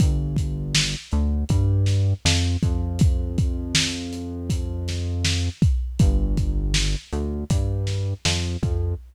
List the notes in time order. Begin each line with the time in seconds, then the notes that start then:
0.00 G1, kick, closed hi-hat
0.36 kick, closed hi-hat
0.75 snare
1.12 D2, closed hi-hat
1.49 G2, kick, closed hi-hat
1.86 snare, closed hi-hat
2.25 F2, snare
2.62 F2, kick, closed hi-hat
2.99 kick, closed hi-hat
3.38 kick, closed hi-hat
3.75 snare
4.13 closed hi-hat
4.50 kick, closed hi-hat
4.88 snare, closed hi-hat
5.25 snare
5.62 kick, closed hi-hat
5.99 G1, kick, closed hi-hat
6.37 kick, closed hi-hat
6.74 snare
7.12 D2, closed hi-hat
7.50 G2, kick, closed hi-hat
7.87 snare, closed hi-hat
8.25 F2, snare
8.63 F2, kick, closed hi-hat